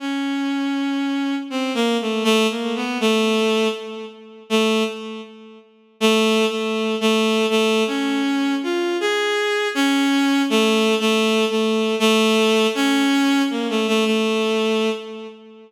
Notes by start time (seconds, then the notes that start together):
0.00 C#4
1.50 C4
1.74 A#3
2.01 A3
2.24 A3
2.50 A#3
2.75 B3
3.00 A3
4.50 A3
6.00 A3
6.50 A3
7.01 A3
7.50 A3
7.87 C#4
8.63 F4
9.00 G#4
9.75 C#4
10.50 A3
11.00 A3
11.50 A3
11.99 A3
12.75 C#4
13.50 A#3
13.70 A3
13.88 A3
14.05 A3